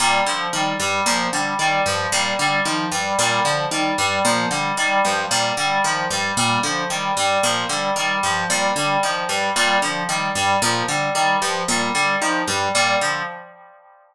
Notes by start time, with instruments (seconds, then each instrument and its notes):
0.00 orchestral harp A#2, electric piano 2 G3
0.26 orchestral harp D3, electric piano 2 F3
0.53 orchestral harp D#3, electric piano 2 G3
0.80 orchestral harp G2, electric piano 2 G3
1.05 orchestral harp A#2, electric piano 2 F3
1.33 orchestral harp D3, electric piano 2 G3
1.59 orchestral harp D#3, electric piano 2 G3
1.86 orchestral harp G2, electric piano 2 F3
2.12 orchestral harp A#2, electric piano 2 G3
2.39 orchestral harp D3, electric piano 2 G3
2.65 orchestral harp D#3, electric piano 2 F3
2.92 orchestral harp G2, electric piano 2 G3
3.19 orchestral harp A#2, electric piano 2 G3
3.44 orchestral harp D3, electric piano 2 F3
3.71 orchestral harp D#3, electric piano 2 G3
3.98 orchestral harp G2, electric piano 2 G3
4.25 orchestral harp A#2, electric piano 2 F3
4.51 orchestral harp D3, electric piano 2 G3
4.77 orchestral harp D#3, electric piano 2 G3
5.05 orchestral harp G2, electric piano 2 F3
5.31 orchestral harp A#2, electric piano 2 G3
5.57 orchestral harp D3, electric piano 2 G3
5.84 orchestral harp D#3, electric piano 2 F3
6.10 orchestral harp G2, electric piano 2 G3
6.37 orchestral harp A#2, electric piano 2 G3
6.63 orchestral harp D3, electric piano 2 F3
6.90 orchestral harp D#3, electric piano 2 G3
7.17 orchestral harp G2, electric piano 2 G3
7.43 orchestral harp A#2, electric piano 2 F3
7.69 orchestral harp D3, electric piano 2 G3
7.96 orchestral harp D#3, electric piano 2 G3
8.23 orchestral harp G2, electric piano 2 F3
8.50 orchestral harp A#2, electric piano 2 G3
8.76 orchestral harp D3, electric piano 2 G3
9.03 orchestral harp D#3, electric piano 2 F3
9.28 orchestral harp G2, electric piano 2 G3
9.56 orchestral harp A#2, electric piano 2 G3
9.82 orchestral harp D3, electric piano 2 F3
10.09 orchestral harp D#3, electric piano 2 G3
10.35 orchestral harp G2, electric piano 2 G3
10.62 orchestral harp A#2, electric piano 2 F3
10.88 orchestral harp D3, electric piano 2 G3
11.15 orchestral harp D#3, electric piano 2 G3
11.41 orchestral harp G2, electric piano 2 F3
11.68 orchestral harp A#2, electric piano 2 G3
11.94 orchestral harp D3, electric piano 2 G3
12.21 orchestral harp D#3, electric piano 2 F3
12.47 orchestral harp G2, electric piano 2 G3
12.74 orchestral harp A#2, electric piano 2 G3
13.01 orchestral harp D3, electric piano 2 F3